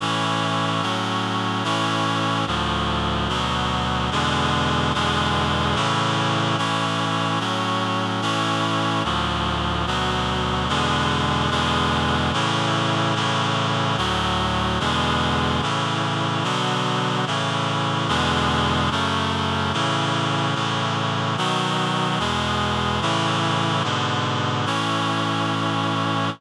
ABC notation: X:1
M:2/2
L:1/8
Q:1/2=73
K:A
V:1 name="Clarinet"
[A,,E,C]4 [A,,F,C]4 | [A,,E,C]4 [D,,A,,=F,]4 | [D,,B,,F,]4 [E,,B,,D,G,]4 | [E,,B,,D,G,]4 [A,,C,E,]4 |
[A,,E,C]4 [A,,F,C]4 | [A,,E,C]4 [D,,A,,=F,]4 | [D,,B,,F,]4 [E,,B,,D,G,]4 | [E,,B,,D,G,]4 [A,,C,E,]4 |
[A,,C,E,]4 [D,,A,,F,]4 | [E,,B,,D,G,]4 [A,,C,E,]4 | [B,,D,F,]4 [A,,C,E,]4 | [E,,B,,D,G,]4 [F,,C,A,]4 |
[A,,C,E,]4 [A,,C,E,]4 | [B,,^D,F,]4 [E,,B,,G,]4 | [A,,C,E,]4 [G,,B,,D,]4 | [A,,E,C]8 |]